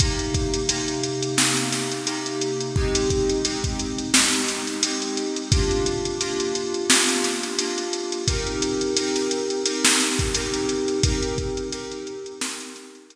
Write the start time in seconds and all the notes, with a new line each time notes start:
0.00 C3 A#3 D#4 G4, kick, closed hi-hat
0.19 closed hi-hat
0.34 kick, closed hi-hat
0.54 closed hi-hat
0.69 C3 A#3 D#4 G4, closed hi-hat
0.88 closed hi-hat
1.03 closed hi-hat
1.23 closed hi-hat
1.37 C3 A#3 D#4 G4, snare
1.57 closed hi-hat
1.72 snare, closed hi-hat
1.92 closed hi-hat
2.07 C3 A#3 D#4 G4, closed hi-hat
2.26 closed hi-hat
2.41 closed hi-hat
2.60 closed hi-hat
2.76 G#3 C4 D#4 G4, kick
2.95 closed hi-hat
3.10 kick, closed hi-hat
3.29 closed hi-hat
3.45 G#3 C4 D#4 G4, closed hi-hat
3.64 kick, closed hi-hat
3.79 closed hi-hat
3.98 closed hi-hat
4.13 G#3 C4 D#4 G4, snare
4.33 closed hi-hat
4.48 snare, closed hi-hat
4.67 snare, closed hi-hat
4.83 G#3 C4 D#4 G4, closed hi-hat
5.02 closed hi-hat
5.17 closed hi-hat
5.36 closed hi-hat
5.52 A#3 D4 F4 G4, kick, closed hi-hat
5.71 closed hi-hat
5.86 closed hi-hat
6.05 closed hi-hat
6.21 A#3 D4 F4 G4, closed hi-hat
6.40 closed hi-hat
6.55 closed hi-hat
6.74 closed hi-hat
6.90 A#3 D4 F4 G4, snare
7.09 closed hi-hat
7.24 snare, closed hi-hat
7.43 snare, closed hi-hat
7.58 A#3 D4 F4 G4, closed hi-hat
7.78 closed hi-hat
7.93 closed hi-hat
8.12 closed hi-hat
8.28 C4 D#4 G4 A#4, kick, closed hi-hat
8.47 closed hi-hat
8.62 closed hi-hat
8.81 closed hi-hat
8.97 C4 D#4 G4 A#4, closed hi-hat
9.16 snare, closed hi-hat
9.31 closed hi-hat
9.50 closed hi-hat
9.65 C4 D#4 G4 A#4, closed hi-hat
9.85 snare
10.00 snare, closed hi-hat
10.19 kick, closed hi-hat
10.34 C4 D#4 G4 A#4, closed hi-hat
10.54 closed hi-hat
10.69 closed hi-hat
10.88 closed hi-hat
11.03 C4 D#4 G4 A#4, kick, closed hi-hat
11.23 closed hi-hat
11.38 kick, closed hi-hat
11.57 closed hi-hat
11.72 C4 D#4 G4 A#4, closed hi-hat
11.92 closed hi-hat
12.07 closed hi-hat
12.26 closed hi-hat
12.41 C4 D#4 G4 A#4, snare
12.60 closed hi-hat
12.76 snare, closed hi-hat
12.95 closed hi-hat
13.10 C4 D#4 G4 A#4, closed hi-hat